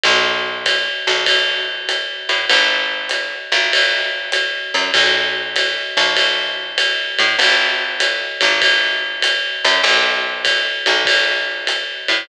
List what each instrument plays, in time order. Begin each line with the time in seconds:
0.03 electric bass (finger) B1, ride
0.66 kick, hi-hat pedal, ride
1.07 electric bass (finger) B1, ride
1.26 kick, ride
1.89 hi-hat pedal, ride
2.29 electric bass (finger) A2, ride
2.49 electric bass (finger) G#1, ride
3.09 hi-hat pedal, ride
3.52 electric bass (finger) G#1, ride
3.73 ride
4.32 hi-hat pedal, ride
4.74 electric bass (finger) F#2, ride
4.94 electric bass (finger) B1, kick, ride
5.56 hi-hat pedal, ride
5.97 electric bass (finger) B1, ride
6.17 ride
6.78 hi-hat pedal, ride
7.18 electric bass (finger) A2, ride
7.39 electric bass (finger) G#1, ride
8.00 hi-hat pedal, ride
8.41 electric bass (finger) G#1, ride
8.62 kick, ride
9.22 hi-hat pedal, ride
9.65 electric bass (finger) F#2, ride
9.84 electric bass (finger) B1, ride
10.45 kick, hi-hat pedal, ride
10.86 electric bass (finger) B1, ride
11.05 kick, ride
11.67 hi-hat pedal, ride
12.08 electric bass (finger) A2, ride